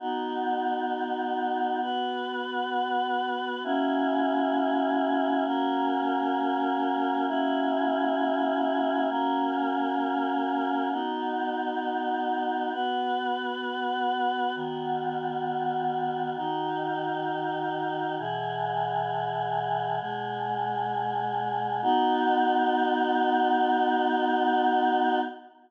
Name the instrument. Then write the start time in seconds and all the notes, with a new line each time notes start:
choir aahs
0.00 B3 D#4 F#4
1.82 B3 F#4 B4
3.64 A#3 C#4 E4 F#4
5.45 A#3 C#4 F#4 A#4
7.27 A#3 C#4 E4 F#4
9.09 A#3 C#4 F#4 A#4
10.91 B3 D#4 F#4
12.73 B3 F#4 B4
14.55 D#3 B3 F#4
16.36 D#3 D#4 F#4
18.18 B2 E3 G#4
20.00 B2 G#3 G#4
21.82 B3 D#4 F#4